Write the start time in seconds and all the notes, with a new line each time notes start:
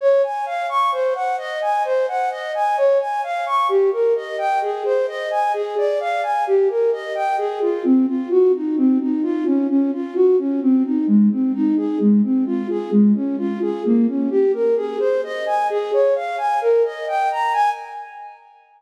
0.01 C#5
0.23 G#5
0.46 F5
0.69 C#6
0.92 C5
1.15 F#5
1.38 D#5
1.62 G#5
1.85 C5
2.08 F#5
2.31 D#5
2.55 G#5
2.77 C#5
3.00 G#5
3.23 F5
3.46 C#6
3.69 G4
3.92 A#4
4.16 D#5
4.38 G5
4.62 G#4
4.85 C5
5.08 D#5
5.31 G#5
5.54 G#4
5.77 D5
6.00 F5
6.23 G#5
6.47 G4
6.69 A#4
6.92 D#5
7.15 G5
7.38 G#4
7.61 F4
7.85 C4
8.07 F4
8.30 F#4
8.54 D#4
8.77 C4
9.00 D#4
9.23 F4
9.45 C#4
9.69 C#4
9.93 F4
10.15 F#4
10.38 C#4
10.62 C4
10.84 D#4
11.07 G#3
11.31 C4
11.54 D#4
11.77 G#4
12.00 G#3
12.23 C4
12.46 F4
12.69 G#4
12.91 G#3
13.15 C#4
13.38 F4
13.62 G#4
13.85 A#3
14.08 C#4
14.30 G4
14.54 A#4
14.76 G#4
15.00 C5
15.24 D#5
15.46 G#5
15.70 G#4
15.93 C#5
16.15 F5
16.38 G#5
16.61 A#4
16.84 D#5
17.08 G5
17.31 A#5
17.53 G#5